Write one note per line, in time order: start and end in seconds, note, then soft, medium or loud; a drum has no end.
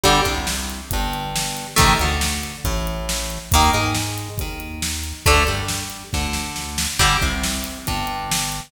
0.04 0.22 G1 medium
0.04 0.21 D3 loud
0.04 0.21 G3 loud
0.04 kick medium
0.04 crash loud
0.25 0.81 C2 medium
0.25 0.80 C3 medium
0.25 kick medium
0.25 closed hi-hat medium
0.47 snare loud
0.70 closed hi-hat medium
0.91 1.66 G1 medium
0.91 1.67 G2 medium
0.91 kick medium
0.91 closed hi-hat loud
1.13 closed hi-hat medium
1.36 snare loud
1.57 closed hi-hat medium
1.76 1.96 A1 medium
1.76 1.94 C3 medium
1.76 1.94 D#3 loud
1.76 1.94 A3 loud
1.76 kick loud
1.76 closed hi-hat loud
2.00 2.55 D2 medium
2.00 2.56 D3 medium
2.00 closed hi-hat medium
2.21 snare loud
2.43 closed hi-hat medium
2.64 3.38 A1 medium
2.64 3.39 A2 medium
2.64 kick medium
2.64 closed hi-hat medium
2.87 closed hi-hat medium
3.09 snare loud
3.30 closed hi-hat medium
3.52 3.70 D#2 medium
3.52 3.71 D#3 loud
3.52 3.71 A#3 loud
3.52 kick loud
3.52 closed hi-hat loud
3.74 4.29 G#2 medium
3.74 4.29 G#3 medium
3.74 closed hi-hat medium
3.94 snare loud
4.18 closed hi-hat medium
4.38 5.13 D#2 medium
4.38 5.15 D#3 medium
4.38 kick medium
4.38 closed hi-hat medium
4.60 closed hi-hat medium
4.82 snare loud
5.04 closed hi-hat medium
5.26 5.45 D2 medium
5.26 5.43 D3 loud
5.26 5.43 A3 loud
5.26 kick loud
5.26 closed hi-hat loud
5.47 6.03 G2 medium
5.47 6.03 G3 medium
5.47 closed hi-hat medium
5.68 snare loud
5.90 closed hi-hat medium
6.13 6.87 D2 medium
6.13 6.88 D3 medium
6.13 kick medium
6.13 snare medium
6.33 snare medium
6.56 snare medium
6.78 snare loud
6.99 7.18 G1 medium
6.99 7.17 D3 loud
6.99 7.17 G3 loud
6.99 kick loud
6.99 crash loud
7.21 7.77 C2 medium
7.21 7.78 C3 medium
7.21 kick medium
7.21 closed hi-hat medium
7.43 snare loud
7.64 closed hi-hat medium
7.87 8.61 G1 medium
7.87 8.61 G2 medium
7.87 kick medium
7.87 closed hi-hat loud
8.07 closed hi-hat medium
8.31 snare loud
8.52 closed hi-hat medium